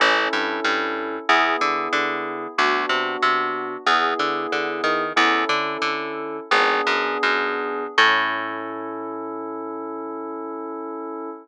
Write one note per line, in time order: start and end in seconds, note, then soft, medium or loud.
0.00 0.28 A1 medium
0.00 1.16 C#4 loud
0.00 1.16 E4 loud
0.00 1.16 A4 loud
0.33 0.60 G2 medium
0.64 1.19 G2 medium
1.29 1.56 E2 medium
1.29 2.45 B3 loud
1.29 2.45 E4 loud
1.29 2.45 G#4 loud
1.61 1.89 D3 medium
1.93 2.47 D3 medium
2.58 2.86 D2 medium
2.58 3.74 B3 loud
2.58 3.74 D4 loud
2.58 3.74 F#4 loud
2.89 3.17 C3 medium
3.22 3.77 C3 medium
3.86 4.14 E2 medium
3.86 5.03 B3 loud
3.86 5.03 E4 loud
3.86 5.03 G#4 loud
4.19 4.47 D3 medium
4.52 4.81 D3 medium
4.84 5.13 D#3 medium
5.16 5.45 E2 medium
5.16 6.37 C#4 loud
5.16 6.37 E4 loud
5.16 6.37 A4 loud
5.49 5.77 D3 medium
5.82 6.40 D3 medium
6.51 6.81 G#1 medium
6.51 7.84 B3 loud
6.51 7.84 D4 loud
6.51 7.84 G#4 loud
6.87 7.18 F#2 medium
7.23 7.87 F#2 medium
7.98 11.29 A2 loud
7.98 11.30 C#4 loud
7.98 11.30 E4 loud
7.98 11.30 A4 loud